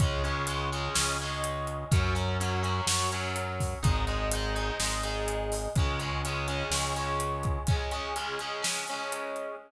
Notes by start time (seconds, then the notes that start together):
0.00 C#2 G#3 C#4, kick, closed hi-hat
0.24 G#3 C#4, closed hi-hat
0.47 G#3 C#4, closed hi-hat
0.72 G#3 C#4, closed hi-hat
0.95 C#2 G#3 C#4, snare
1.20 G#3 C#4, closed hi-hat
1.44 closed hi-hat
1.67 closed hi-hat
1.91 F#2 F#3 C#4, kick, closed hi-hat
2.15 F#3 C#4, closed hi-hat
2.40 F#3 C#4, closed hi-hat
2.63 F#3 C#4, closed hi-hat
2.86 F#2 F#3 C#4, snare
3.12 F#3 C#4, closed hi-hat
3.36 closed hi-hat
3.60 kick, open hi-hat
3.83 G#1 G#3 D#4, kick, closed hi-hat
4.07 G#3 D#4, closed hi-hat
4.32 G#3 D#4, closed hi-hat
4.55 G#3 D#4, closed hi-hat
4.80 G#1 G#3 D#4, snare
5.03 G#3 D#4, closed hi-hat
5.28 closed hi-hat
5.52 open hi-hat
5.75 C#2 G#3 C#4, kick, closed hi-hat
6.00 G#3 C#4, closed hi-hat
6.25 G#3 C#4, closed hi-hat
6.48 G#3 C#4, closed hi-hat
6.70 C#2 G#3 C#4, snare
6.96 G#3 C#4, closed hi-hat
7.20 closed hi-hat
7.43 kick, closed hi-hat
7.67 G#3 C#4, kick, closed hi-hat
7.91 G#3 C#4, closed hi-hat
8.16 G#3 C#4, closed hi-hat
8.39 G#3 C#4, closed hi-hat
8.62 G#3 C#4, snare
8.88 G#3 C#4, closed hi-hat
9.12 closed hi-hat
9.36 closed hi-hat